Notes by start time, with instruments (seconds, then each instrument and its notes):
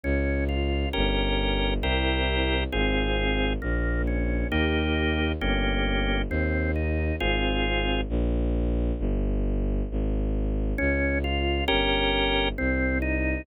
0.03 violin C#2, drawbar organ C#4
0.49 drawbar organ F4
0.93 violin G1, drawbar organ C#4 G4 A#4
1.81 violin C2, drawbar organ C4 E4 G4 A#4
2.72 violin G#1, drawbar organ C4 F4 G#4
3.62 violin A#1, drawbar organ A#3
4.07 drawbar organ C#4
4.51 violin D#2, drawbar organ A#3 D#4 G4
5.40 violin G1, drawbar organ A#3 C#4 G4
6.29 violin D#2, drawbar organ C4
6.76 drawbar organ D#4
7.20 violin G#1, drawbar organ C4 F4 G#4
8.09 violin A#1
8.99 violin G1
9.91 violin G#1
10.78 violin C#2, drawbar organ C#4
11.24 drawbar organ F4
11.68 violin G1, drawbar organ C#4 G4 A#4
12.58 violin C2, drawbar organ C4
13.02 drawbar organ D#4